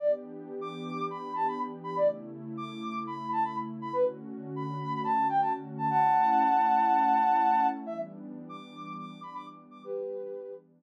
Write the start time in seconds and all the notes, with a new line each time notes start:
0.00 E3 B3 D4 G4 D5
0.61 D6
1.10 B5
1.35 A5
1.48 B5
1.84 B5
1.96 C#3 A3 E4 D5
2.57 D6
3.07 B5
3.32 A5
3.44 B5
3.82 B5
3.93 D3 A3 C#4 F#4 B4
4.56 B5
5.04 A5
5.29 G5
5.41 A5
5.78 A5
5.90 A3 C#4 E4 F#5 A5
7.86 E3 G3 B3 D4 E5
8.49 D6
8.98 D6
9.23 B5
9.35 D6
9.71 D6
9.84 E3 G3 B3 D4 G4 B4